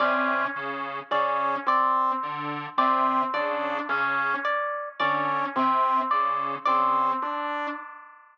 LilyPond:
<<
  \new Staff \with { instrumentName = "Lead 1 (square)" } { \clef bass \time 7/8 \tempo 4 = 54 c8 cis8 cis8 r8 d8 c8 cis8 | cis8 r8 d8 c8 cis8 cis8 r8 | }
  \new Staff \with { instrumentName = "Lead 2 (sawtooth)" } { \time 7/8 cis'8 r8 cis'8 c'8 r8 c'8 d'8 | cis'8 r8 cis'8 c'8 r8 c'8 d'8 | }
  \new Staff \with { instrumentName = "Orchestral Harp" } { \time 7/8 d''8 r8 d''8 d''8 r8 d''8 d''8 | r8 d''8 d''8 r8 d''8 d''8 r8 | }
>>